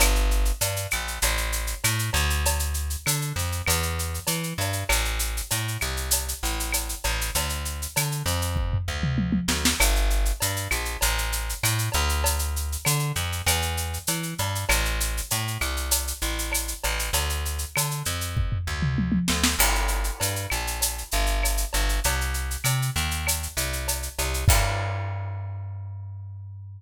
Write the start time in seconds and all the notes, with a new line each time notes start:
0.00 G1, cowbell, claves, shaker
0.15 shaker
0.31 shaker
0.45 shaker
0.61 G2, cowbell, shaker
0.76 shaker
0.91 A#1, claves, shaker
1.08 shaker
1.22 A1, cowbell, shaker
1.37 shaker
1.52 shaker
1.67 shaker
1.84 A2, cowbell, claves, shaker
1.99 shaker
2.13 D2, cowbell, shaker
2.30 shaker
2.45 cowbell, shaker
2.59 shaker
2.74 shaker
2.90 shaker
3.06 D3, cowbell, claves, shaker
3.21 shaker
3.36 F2, shaker
3.52 shaker
3.66 E2, cowbell, claves, shaker
3.83 shaker
3.99 shaker
4.14 shaker
4.27 E3, cowbell, shaker
4.43 shaker
4.58 G2, cowbell, shaker
4.73 shaker
4.89 A1, cowbell, claves, shaker
5.05 shaker
5.19 shaker
5.37 shaker
5.51 A2, cowbell, shaker
5.68 shaker
5.81 C2, claves, shaker
5.97 shaker
6.11 cowbell, shaker
6.28 shaker
6.43 A1, shaker
6.60 shaker
6.72 cowbell, claves, shaker
6.89 shaker
7.04 A1, cowbell, shaker
7.21 shaker
7.35 D2, cowbell, shaker
7.49 shaker
7.65 shaker
7.82 shaker
7.96 D3, cowbell, claves, shaker
8.12 shaker
8.26 F2, shaker
8.42 shaker
8.56 kick, floor tom
8.73 floor tom
8.88 D2
9.03 mid tom
9.18 high tom
9.32 high tom
9.48 D2, snare
9.65 snare
9.80 G1, cowbell, claves, shaker
9.96 shaker
10.10 shaker
10.25 shaker
10.40 G2, cowbell, shaker
10.56 shaker
10.71 A#1, claves, shaker
10.85 shaker
11.01 A1, cowbell, shaker
11.18 shaker
11.32 shaker
11.49 shaker
11.63 A2, cowbell, claves, shaker
11.78 shaker
11.92 D2, cowbell, shaker
12.09 shaker
12.24 cowbell, shaker
12.39 shaker
12.56 shaker
12.72 shaker
12.85 D3, cowbell, claves, shaker
12.99 shaker
13.15 F2, shaker
13.32 shaker
13.46 E2, cowbell, claves, shaker
13.62 shaker
13.77 shaker
13.93 shaker
14.07 E3, cowbell, shaker
14.23 shaker
14.38 G2, cowbell, shaker
14.55 shaker
14.69 A1, cowbell, claves, shaker
14.85 shaker
15.00 shaker
15.17 shaker
15.30 A2, cowbell, shaker
15.47 shaker
15.61 C2, claves, shaker
15.77 shaker
15.91 cowbell, shaker
16.07 shaker
16.21 A1, shaker
16.39 shaker
16.52 cowbell, claves, shaker
16.68 shaker
16.84 A1, cowbell, shaker
16.99 shaker
17.13 D2, cowbell, shaker
17.29 shaker
17.45 shaker
17.59 shaker
17.76 D3, cowbell, claves, shaker
17.91 shaker
18.05 F2, shaker
18.21 shaker
18.37 kick, floor tom
18.52 floor tom
18.67 D2
18.82 mid tom
18.98 high tom
19.12 high tom
19.28 D2, snare
19.43 snare
19.59 G1, crash, cowbell, claves
19.75 shaker
19.88 shaker
20.04 shaker
20.20 G2, cowbell, shaker
20.36 shaker
20.50 A#1, claves, shaker
20.67 shaker
20.81 cowbell, shaker
20.98 shaker
21.11 G1, shaker
21.26 shaker
21.43 cowbell, claves, shaker
21.57 shaker
21.73 G1, cowbell, shaker
21.89 shaker
22.04 C2, cowbell, shaker
22.21 shaker
22.34 shaker
22.51 shaker
22.64 C3, cowbell, claves, shaker
22.82 shaker
22.96 D#2, shaker
23.11 shaker
23.27 cowbell, claves, shaker
23.43 shaker
23.57 C2, shaker
23.73 shaker
23.88 cowbell, shaker
24.03 shaker
24.18 C2, cowbell, shaker
24.34 shaker
24.48 G2, kick, crash